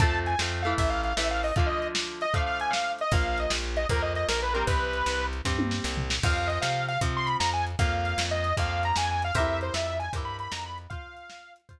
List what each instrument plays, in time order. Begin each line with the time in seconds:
0.00 electric bass (finger) F2, overdriven guitar F3 A3 C4, lead 2 (sawtooth) A5, kick, closed hi-hat
0.26 lead 2 (sawtooth) G#5, closed hi-hat
0.39 electric bass (finger) F2, overdriven guitar F3 A3 C4, snare
0.63 overdriven guitar E3 A3, lead 2 (sawtooth) F5, closed hi-hat
0.78 electric bass (finger) A1, lead 2 (sawtooth) E5, kick, closed hi-hat
0.89 lead 2 (sawtooth) F5
1.04 lead 2 (sawtooth) F5, closed hi-hat
1.17 electric bass (finger) A1, overdriven guitar E3 A3, lead 2 (sawtooth) E5, snare
1.31 lead 2 (sawtooth) F5
1.43 lead 2 (sawtooth) D#5, open hi-hat
1.56 overdriven guitar D3 F3 A3, lead 2 (sawtooth) F5, kick, closed hi-hat
1.66 lead 2 (sawtooth) D#5
1.82 closed hi-hat
1.95 snare
2.21 lead 2 (sawtooth) D#5, closed hi-hat
2.34 overdriven guitar D3 F3 A3, lead 2 (sawtooth) F5, kick, closed hi-hat
2.46 lead 2 (sawtooth) F5
2.60 lead 2 (sawtooth) G#5, closed hi-hat
2.70 lead 2 (sawtooth) F5, snare
2.99 lead 2 (sawtooth) D#5, closed hi-hat
3.11 electric bass (finger) A#1, overdriven guitar F3 A#3, lead 2 (sawtooth) F5, kick, closed hi-hat
3.38 lead 2 (sawtooth) D#5, closed hi-hat
3.50 electric bass (finger) A#1, snare
3.77 lead 2 (sawtooth) D#5, closed hi-hat
3.89 electric bass (finger) F2, overdriven guitar F3 A#3, lead 2 (sawtooth) A#4, kick, closed hi-hat
4.02 lead 2 (sawtooth) D#5
4.15 lead 2 (sawtooth) D#5, closed hi-hat
4.29 electric bass (finger) A#1, lead 2 (sawtooth) A#4, snare
4.42 lead 2 (sawtooth) B4
4.53 overdriven guitar G3 C4, lead 2 (sawtooth) A#4, closed hi-hat
4.67 electric bass (finger) C2, lead 2 (sawtooth) B4, kick, closed hi-hat
4.93 closed hi-hat
5.06 electric bass (finger) C2, snare
5.33 closed hi-hat
5.45 electric bass (finger) G2, overdriven guitar G3 C4, kick, snare
5.59 high tom
5.71 snare
5.84 electric bass (finger) C2, snare
5.97 floor tom
6.10 snare
6.23 electric bass (finger) F2, overdriven guitar F3 C4, lead 2 (sawtooth) F5, kick, crash
6.47 lead 2 (sawtooth) D#5, closed hi-hat
6.61 electric bass (finger) C3, lead 2 (sawtooth) F5, snare
6.88 lead 2 (sawtooth) F5, closed hi-hat
7.01 electric bass (finger) C3, overdriven guitar F3 C4, kick, closed hi-hat
7.17 lead 2 (sawtooth) C6
7.26 lead 2 (sawtooth) B5, closed hi-hat
7.40 electric bass (finger) F2, lead 2 (sawtooth) A#5, snare
7.53 lead 2 (sawtooth) G#5
7.67 closed hi-hat
7.79 electric bass (finger) F2, overdriven guitar F3 A#3, lead 2 (sawtooth) F5, kick, closed hi-hat
8.05 closed hi-hat
8.18 electric bass (finger) F2, snare
8.31 lead 2 (sawtooth) D#5
8.44 closed hi-hat
8.57 electric bass (finger) F2, overdriven guitar F3 A#3, lead 2 (sawtooth) F5, kick, closed hi-hat
8.83 lead 2 (sawtooth) A#5, closed hi-hat
8.96 electric bass (finger) F2, lead 2 (sawtooth) G#5, snare
9.11 lead 2 (sawtooth) G#5
9.22 lead 2 (sawtooth) F5, closed hi-hat
9.35 electric bass (finger) F2, overdriven guitar G4 A#4 C5, lead 2 (sawtooth) E5, kick, closed hi-hat
9.40 overdriven guitar E4
9.61 lead 2 (sawtooth) C5, closed hi-hat
9.74 electric bass (finger) F2, lead 2 (sawtooth) E5, snare
9.99 lead 2 (sawtooth) G#5, closed hi-hat
10.13 electric bass (finger) G2, overdriven guitar G4 A#4 C5, kick, closed hi-hat
10.18 overdriven guitar E4
10.25 lead 2 (sawtooth) B5
10.39 lead 2 (sawtooth) B5, closed hi-hat
10.52 electric bass (finger) F2, lead 2 (sawtooth) A#5, snare
10.66 lead 2 (sawtooth) B5
10.78 closed hi-hat
10.90 overdriven guitar F4 C5, lead 2 (sawtooth) F5, kick, closed hi-hat
11.17 closed hi-hat
11.30 snare
11.56 closed hi-hat
11.69 overdriven guitar F4 C5, kick, closed hi-hat